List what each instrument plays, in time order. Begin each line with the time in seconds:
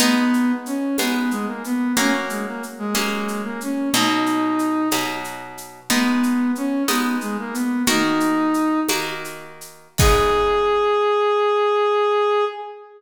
0.00 orchestral harp G#3 B3 D#4, brass section B3, low conga, shaker
0.33 shaker
0.66 brass section C#4, shaker
0.98 orchestral harp G#3 B3 D#4, brass section B3, tambourine, high conga, shaker
1.31 brass section G#3, shaker
1.47 brass section A#3
1.64 brass section B3, shaker
1.96 orchestral harp F#3 A#3 C#4, brass section C#4, low conga, shaker
2.30 brass section G#3, shaker
2.47 brass section A#3
2.63 shaker
2.78 brass section G#3
2.95 orchestral harp F#3 A#3 C#4, tambourine, high conga, shaker
3.28 shaker
3.44 brass section A#3
3.61 brass section C#4, shaker
3.94 orchestral harp B2 F#3 D#4, brass section D#4, low conga, shaker
4.26 shaker
4.59 shaker
4.91 orchestral harp B2 F#3 D#4, tambourine, high conga, shaker
5.24 shaker
5.58 shaker
5.90 orchestral harp G#3 B3 D#4, brass section B3, low conga, shaker
6.23 shaker
6.55 brass section C#4, shaker
6.88 orchestral harp G#3 B3 D#4, brass section B3, tambourine, high conga, shaker
7.21 brass section G#3, shaker
7.39 brass section A#3
7.53 brass section B3, shaker
7.87 orchestral harp D#3 A#3 F#4, brass section D#4, low conga, shaker
8.20 shaker
8.54 shaker
8.88 orchestral harp D#3 A#3 F#4, tambourine, high conga, shaker
9.24 shaker
9.61 shaker
9.98 orchestral harp G#3 B3 D#4, brass section G#4, kick, crash